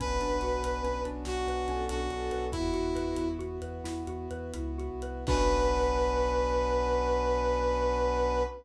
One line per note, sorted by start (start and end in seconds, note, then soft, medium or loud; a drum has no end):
0.00 0.18 B1 loud
0.00 2.50 B3 medium
0.00 2.50 C#4 medium
0.00 0.19 C#4 loud
0.00 2.50 D4 medium
0.00 2.50 F#4 medium
0.00 1.05 B4 medium
0.00 1.03 B4 medium
0.00 kick medium
0.00 closed hi-hat medium
0.21 0.39 B1 medium
0.21 0.40 D4 medium
0.21 closed hi-hat medium
0.41 0.60 B1 medium
0.41 0.61 F#4 medium
0.41 closed hi-hat medium
0.63 0.81 B1 medium
0.63 0.82 B4 medium
0.63 closed hi-hat medium
0.84 1.02 B1 medium
0.84 1.03 C#4 medium
0.84 closed hi-hat medium
1.05 1.23 B1 medium
1.05 1.24 D4 medium
1.05 closed hi-hat medium
1.25 1.44 B1 medium
1.25 1.46 F#4 medium
1.25 1.85 F#4 medium
1.25 snare medium
1.47 1.65 B1 medium
1.47 1.67 B4 medium
1.47 closed hi-hat medium
1.67 1.86 B1 medium
1.67 1.88 C#4 loud
1.67 2.01 A4 medium
1.67 closed hi-hat medium
1.89 2.08 B1 medium
1.89 2.09 D4 medium
1.89 2.45 F#4 medium
1.89 closed hi-hat loud
2.10 2.28 B1 medium
2.10 2.30 F#4 medium
2.10 2.46 A4 medium
2.10 closed hi-hat medium
2.31 2.49 B1 medium
2.31 2.50 B4 medium
2.31 closed hi-hat medium
2.52 2.71 E2 loud
2.52 5.25 B3 medium
2.52 3.29 E4 medium
2.52 5.25 E4 medium
2.52 2.72 E4 loud
2.52 3.28 F#4 medium
2.52 5.25 F#4 medium
2.52 kick medium
2.52 closed hi-hat medium
2.74 2.92 E2 medium
2.74 2.93 F#4 medium
2.74 closed hi-hat medium
2.95 3.14 E2 medium
2.95 3.15 B4 medium
2.95 closed hi-hat medium
3.16 3.36 E2 medium
3.16 3.37 E4 medium
3.16 closed hi-hat medium
3.39 3.58 E2 medium
3.39 3.59 F#4 loud
3.39 closed hi-hat medium
3.62 3.81 E2 medium
3.62 3.82 B4 medium
3.62 closed hi-hat medium
3.84 4.04 E2 medium
3.84 4.05 E4 medium
3.84 snare medium
4.07 4.27 E2 medium
4.07 4.29 F#4 medium
4.07 closed hi-hat medium
4.31 4.51 E2 medium
4.31 4.52 B4 medium
4.31 closed hi-hat medium
4.54 4.87 C#2 medium
4.54 4.76 E4 medium
4.54 closed hi-hat medium
4.78 5.00 F#4 medium
4.78 closed hi-hat medium
4.91 5.24 C2 medium
5.02 5.25 B4 medium
5.02 closed hi-hat medium
5.27 8.43 B1 loud
5.27 8.43 B3 loud
5.27 8.43 C#4 loud
5.27 8.43 D4 loud
5.27 8.43 F#4 loud
5.27 8.43 B4 loud
5.27 8.43 B4 medium
5.27 8.43 B4 loud
5.27 kick loud
5.27 crash loud